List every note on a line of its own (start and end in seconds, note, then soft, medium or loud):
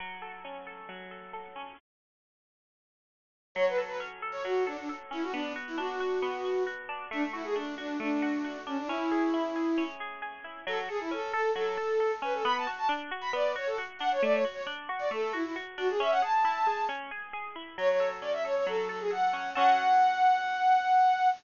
0.00 0.88 F#3 medium
0.22 0.66 A4 medium
0.45 1.55 C#4 medium
0.67 1.11 A4 medium
0.89 1.73 F#3 medium
1.11 1.33 A4 medium
1.33 1.76 A4 medium
1.56 1.77 C#4 medium
3.55 4.44 F#3 medium
3.55 3.65 C#5 medium
3.68 3.79 B4 medium
3.78 4.22 A4 medium
3.87 3.98 B4 medium
4.00 5.10 C#4 medium
4.22 4.66 A4 medium
4.32 4.43 C#5 medium
4.44 5.29 F#3 medium
4.44 4.64 F#4 medium
4.67 4.77 D4 medium
4.67 4.89 A4 medium
4.78 4.89 D4 medium
4.89 5.31 A4 medium
5.11 5.32 C#4 medium
5.11 5.23 E4 medium
5.23 5.34 F#4 medium
5.32 6.22 B3 loud
5.32 5.53 D4 medium
5.56 6.00 F#4 medium
5.68 5.78 E4 medium
5.78 6.88 D4 medium
5.78 6.63 F#4 medium
6.00 6.44 F#4 medium
6.22 7.07 B3 medium
6.45 6.66 F#4 medium
6.67 7.09 F#4 medium
6.89 7.10 D4 medium
7.11 7.99 A3 loud
7.11 7.23 D4 medium
7.33 7.44 E4 medium
7.33 7.77 F#4 medium
7.44 7.55 G#4 medium
7.56 7.75 D4 medium
7.56 8.66 D4 medium
7.78 7.97 D4 medium
7.78 8.22 F#4 medium
8.00 8.84 A3 medium
8.00 8.58 D4 medium
8.22 8.44 F#4 medium
8.44 8.87 F#4 medium
8.66 8.77 C#4 medium
8.66 8.88 D4 medium
8.78 8.89 D4 medium
8.87 9.77 C#4 loud
8.87 9.83 E4 medium
9.11 9.55 G#4 medium
9.34 10.44 E4 medium
9.56 10.00 G#4 medium
9.78 10.62 C#4 medium
10.00 10.21 G#4 medium
10.22 10.64 G#4 medium
10.44 10.65 E4 medium
10.67 10.89 F#3 loud
10.67 10.78 A4 medium
10.89 10.99 G#4 medium
10.89 11.11 A4 medium
11.00 11.11 E4 medium
11.11 11.33 C#4 medium
11.11 11.32 A4 medium
11.33 11.51 A4 medium
11.33 11.56 A4 medium
11.55 11.78 F#3 loud
11.55 12.12 A4 medium
11.77 12.00 A4 medium
12.00 12.22 A4 medium
12.22 12.43 C#4 loud
12.22 12.34 B4 medium
12.34 12.45 A4 medium
12.44 12.67 B3 loud
12.44 12.55 B5 medium
12.57 12.68 A5 medium
12.67 12.89 F#4 medium
12.78 12.88 A5 medium
12.89 13.11 D4 loud
13.11 13.34 F#4 loud
13.21 13.32 B5 medium
13.33 13.55 B3 loud
13.33 13.52 D5 medium
13.56 13.78 F#4 medium
13.56 13.68 C#5 medium
13.67 13.77 A4 medium
13.78 14.00 F#4 loud
13.99 14.21 D4 medium
13.99 14.09 F#5 medium
14.12 14.22 C#5 medium
14.22 14.45 A3 loud
14.22 14.33 D5 medium
14.33 14.44 C#5 medium
14.44 14.67 F#4 medium
14.54 14.64 C#5 medium
14.67 14.89 D4 medium
14.89 15.11 F#4 loud
14.99 15.10 D5 medium
15.11 15.33 A3 loud
15.11 15.32 A4 medium
15.33 15.44 E4 medium
15.33 15.55 F#4 medium
15.44 15.55 E4 medium
15.56 15.78 F#4 medium
15.78 15.99 D4 medium
15.78 15.88 F#4 medium
15.89 16.00 G#4 medium
16.00 16.22 C#4 loud
16.00 16.11 E5 medium
16.11 16.21 F#5 medium
16.22 16.44 G#4 loud
16.22 16.84 A5 medium
16.45 16.67 E4 loud
16.67 16.89 G#4 medium
16.89 17.11 C#4 loud
17.11 17.33 G#4 medium
17.33 17.56 G#4 loud
17.56 17.77 E4 medium
17.78 18.66 F#3 loud
17.78 17.89 C#5 medium
17.89 18.09 C#5 medium
18.00 18.44 A4 medium
18.21 19.33 C#4 medium
18.21 18.32 D5 medium
18.33 18.43 E5 medium
18.45 18.89 A4 medium
18.45 18.55 C#5 medium
18.56 18.67 C#5 medium
18.67 19.51 F#3 medium
18.67 18.88 A4 medium
18.88 18.99 A4 medium
18.88 19.10 A4 medium
19.00 19.11 G#4 medium
19.11 19.53 A4 medium
19.11 19.50 F#5 medium
19.33 19.54 C#4 medium
19.54 21.29 F#3 medium
19.54 21.29 C#4 loud
19.54 21.29 A4 medium
19.54 21.28 F#5 loud